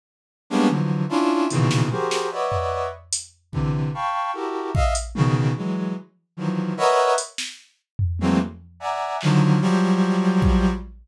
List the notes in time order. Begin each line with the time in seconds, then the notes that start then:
0.50 G3 G#3 A#3 B3 C#4 D4
0.68 D3 E3 F3 F#3
1.09 C#4 D4 E4 F4
1.50 A#2 B2 C#3 D#3 E3, closed hi-hat
1.71 snare
1.91 F#4 G4 G#4 A#4 C5, high tom
2.11 snare
2.32 B4 C#5 D5 D#5 E5 F#5
2.52 floor tom
3.13 closed hi-hat
3.52 C3 D3 E3, kick
3.94 F5 G5 A5 B5 C#6
4.34 E4 F#4 G4 A4 A#4
4.74 D#5 E5 F5, kick
4.95 closed hi-hat
5.15 B2 C#3 D#3, high tom
5.57 E3 F#3 G#3
6.37 D#3 E3 F3 F#3
6.77 A#4 B4 C#5 D#5 E5 F#5
7.18 closed hi-hat
7.38 snare
7.99 floor tom
8.19 E3 F#3 G#3 A3 A#3 C4, high tom
8.80 D5 E5 F#5 G#5 A#5
9.21 D3 D#3 F3 F#3, clap
9.61 F3 F#3 G3
10.42 kick